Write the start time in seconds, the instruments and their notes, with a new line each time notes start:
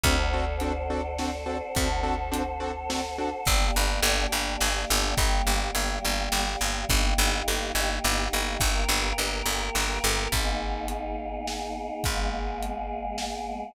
0.03 electric bass (finger) D2, acoustic grand piano C4 D4 F#4 A4, choir aahs A4 C5 D5 F#5, kick, closed hi-hat
0.33 acoustic grand piano C4 D4 F#4 A4
0.60 acoustic grand piano C4 D4 F#4 A4, closed hi-hat
0.90 acoustic grand piano C4 D4 F#4 A4
1.18 acoustic grand piano C4 D4 F#4 A4, snare
1.46 acoustic grand piano C4 D4 F#4 A4
1.75 electric bass (finger) D2, acoustic grand piano C4 D4 F#4 A4, choir aahs A4 C5 F#5 A5, kick, closed hi-hat
2.03 acoustic grand piano C4 D4 F#4 A4
2.32 acoustic grand piano C4 D4 F#4 A4, closed hi-hat
2.60 acoustic grand piano C4 D4 F#4 A4
2.90 acoustic grand piano C4 D4 F#4 A4, snare
3.18 acoustic grand piano C4 D4 F#4 A4
3.45 electric bass (finger) G1, choir aahs A#3 D4 G4, kick, crash
3.76 electric bass (finger) G1
4.03 electric bass (finger) G1, ride
4.32 electric bass (finger) G1
4.60 electric bass (finger) G1, snare
4.90 electric bass (finger) G1
5.17 electric bass (finger) G1, choir aahs G3 A#3 G4, kick, ride
5.47 electric bass (finger) G1
5.75 electric bass (finger) G1, ride
6.05 electric bass (finger) G1
6.32 electric bass (finger) G1, snare
6.61 electric bass (finger) G1
6.89 electric bass (finger) G1, choir aahs A#3 D#4 G4, kick, ride
7.18 electric bass (finger) G1
7.48 electric bass (finger) G1, ride
7.75 electric bass (finger) G1
8.04 electric bass (finger) G1, snare
8.33 electric bass (finger) G1
8.60 electric bass (finger) G1, choir aahs A#3 G4 A#4, kick, ride
8.88 electric bass (finger) G1
9.18 electric bass (finger) G1, ride
9.46 electric bass (finger) G1
9.75 electric bass (finger) G1, snare
10.04 electric bass (finger) G1
10.32 electric bass (finger) G#1, choir aahs A#3 B3 D#4 G#4, kick, closed hi-hat
10.88 closed hi-hat
11.47 snare
12.04 electric bass (finger) G#1, choir aahs G#3 A#3 B3 G#4, kick, closed hi-hat
12.63 closed hi-hat
13.18 snare